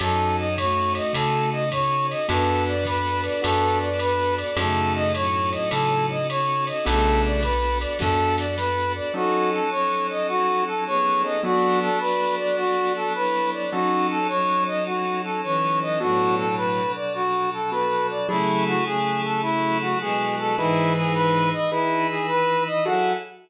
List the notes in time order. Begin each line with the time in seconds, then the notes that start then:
0.00 F#2 F#3 C#4 D#4 F#4 A4, ride
0.38 D#5
0.56 A3 F#4 C#5, kick, hi-hat pedal, ride
0.95 D#5, ride
1.13 C#3 A4, kick, ride
1.52 D#5
1.70 C#5, kick, hi-hat pedal, ride
2.10 D#5, ride
2.28 F#2 B3 D4 F#4 A4 B4, kick, ride
2.68 D5
2.85 B4, kick, hi-hat pedal, ride
3.24 D5, ride
3.42 F#2 B3 D4 F#4 A4, ride
3.82 D5
3.99 B4, hi-hat pedal, ride
4.38 D5, ride
4.56 F#2 C#3 A3 C#4 D#4 F#4 A4, ride
4.95 D#5
5.14 A2 F#3 C#5, hi-hat pedal, ride
5.53 D#5, ride
5.71 C#3 A4, ride
6.10 D#5
6.29 C#5, hi-hat pedal, ride
6.67 D#5, ride
6.85 B1 C#3 A3 B3 D4 F#4 A4, kick, ride
7.25 D5
7.43 B4, kick, hi-hat pedal, ride
7.81 D5, ride
7.99 F#2 B3 D4 F#4 A4, kick, snare
8.38 D5, snare
8.57 B4, snare
8.95 D5
9.14 F#3 C#4 D#4 F#4 A4
9.53 A4
9.71 C#4 A4 C#5
10.10 D#5
10.28 F#4
10.67 A4
10.86 B3 G#4 C#5
11.24 F#3 C#4 D#4 A4 D#5
11.43 F#3 B3 D4 F#4 A4 D5
11.82 A4
11.99 F#4 B4 D5
12.39 D5
12.57 F#4
12.96 A4
13.14 E4 B4 C#5
13.53 D5
13.71 F#3 C#4 D#4 F#4 A4
14.10 A4
14.28 F#3 D#4 C#5
14.67 D#5
14.86 F#4
15.24 A4
15.43 E3 C#4 C#5
15.82 D#5
16.00 A2 B2 F#3 B3 D4 F#4 A4
16.38 A4
16.56 B4
16.96 D5
17.14 F#4
17.53 A4
17.71 B3 D4 F#4 A4 B4
18.10 D5
18.28 C#3 F#3 A3 E4 G#4 A4
18.67 F#4
18.85 C#3 A3 G#4
19.24 A4
19.42 F#3 E4 F#4 A4
19.81 F#4
20.00 B2 G#3 G#4
20.39 A4
20.57 G#2 E3 D#4 E4 G#4 B4
20.96 G#4
21.14 B4
21.53 D#5
21.71 E3 D#4 E4 G#4 B4
22.10 G#4
22.28 B4
22.67 D#5
22.85 F#3 E4 F#4 G#4 A4 F#5